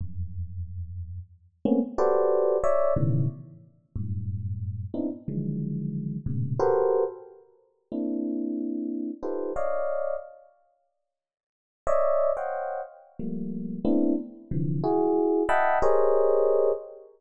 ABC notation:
X:1
M:2/4
L:1/16
Q:1/4=91
K:none
V:1 name="Electric Piano 1"
[E,,F,,^F,,]8 | z2 [A,^A,B,C^C] z [^FG=AB=cd]4 | [^cde]2 [A,,B,,^C,^D,E,]2 z4 | [^F,,G,,A,,]6 [B,CD^DE] z |
[D,^D,E,F,^F,^G,]6 [=G,,^G,,^A,,B,,^C,]2 | [^FGA^ABc]3 z5 | [^A,CDE]8 | [^DFGABc]2 [^c=d^df]4 z2 |
z8 | [^cd^de]3 [=c^cdf^fg]3 z2 | [F,G,A,^A,]4 [=A,B,CDE]2 z2 | [C,D,E,F,]2 [E^F^G]4 [^de^f=gab]2 |
[G^G^Ac^c^d]6 z2 |]